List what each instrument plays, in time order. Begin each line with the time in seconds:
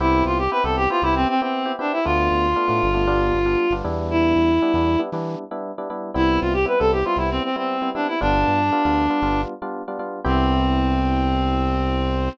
0.00 synth bass 1 C2, electric piano 1 B3 C4 E4 G4, clarinet E4
0.25 synth bass 1 C2, clarinet F4
0.38 clarinet G4
0.51 electric piano 1 B3 C4 E4 G4, clarinet B4
0.64 synth bass 1 C2, electric piano 1 B3 C4 E4 G4, clarinet A4
0.77 clarinet G4
0.90 electric piano 1 B3 C4 E4 G4, clarinet F4
1.02 synth bass 1 C2, electric piano 1 B3 C4 E4 G4, clarinet E4
1.15 clarinet C4
1.28 clarinet C4
1.41 electric piano 1 B3 C4 E4 G4, clarinet C4
1.66 electric piano 1 B3 C4 E4 G4
1.79 electric piano 1 B3 C4 E4 G4, clarinet D4
1.92 clarinet E4
2.05 synth bass 1 D2, electric piano 1 A3 B3 D4 F4, clarinet F4
2.31 synth bass 1 D2
2.56 electric piano 1 A3 B3 D4 F4
2.68 synth bass 1 A2, electric piano 1 A3 B3 D4 F4
2.83 synth bass 1 G1
2.94 electric piano 1 A3 B3 D4 F4
3.07 electric piano 1 G3 B3 D4 F4
3.33 synth bass 1 G1
3.46 electric piano 1 G3 B3 D4 F4
3.71 synth bass 1 G1, electric piano 1 G3 B3 D4 F4
3.84 synth bass 1 E2, electric piano 1 G3 B3 D4 E4
4.11 clarinet E4
4.36 synth bass 1 E2
4.62 electric piano 1 G3 B3 D4 E4
4.74 synth bass 1 E2, electric piano 1 G3 B3 D4 E4
4.99 electric piano 1 G3 B3 D4 E4
5.12 synth bass 1 E3, electric piano 1 G3 B3 D4 E4
5.51 electric piano 1 G3 B3 D4 E4
5.78 electric piano 1 G3 B3 D4 E4
5.90 electric piano 1 G3 B3 D4 E4
6.14 synth bass 1 C2, electric piano 1 G3 B3 C4 E4, clarinet E4
6.41 synth bass 1 C2, clarinet F4
6.53 clarinet G4
6.65 electric piano 1 G3 B3 C4 E4, clarinet B4
6.79 synth bass 1 C2, electric piano 1 G3 B3 C4 E4, clarinet A4
6.92 clarinet G4
7.05 electric piano 1 G3 B3 C4 E4, clarinet F4
7.16 synth bass 1 C2, electric piano 1 G3 B3 C4 E4, clarinet E4
7.31 clarinet C4
7.44 clarinet C4
7.56 electric piano 1 G3 B3 C4 E4, clarinet C4
7.82 electric piano 1 G3 B3 C4 E4
7.95 electric piano 1 G3 B3 C4 E4, clarinet D4
8.07 clarinet E4
8.21 synth bass 1 G1, electric piano 1 G3 B3 D4 F4, clarinet D4
8.48 synth bass 1 G2
8.72 electric piano 1 G3 B3 D4 F4
8.85 synth bass 1 D2, electric piano 1 G3 B3 D4 F4
9.10 electric piano 1 G3 B3 D4 F4
9.22 synth bass 1 G1, electric piano 1 G3 B3 D4 F4
9.62 electric piano 1 G3 B3 D4 F4
9.88 electric piano 1 G3 B3 D4 F4
9.99 electric piano 1 G3 B3 D4 F4
10.24 synth bass 1 C2, electric piano 1 B3 C4 E4 G4, clarinet C4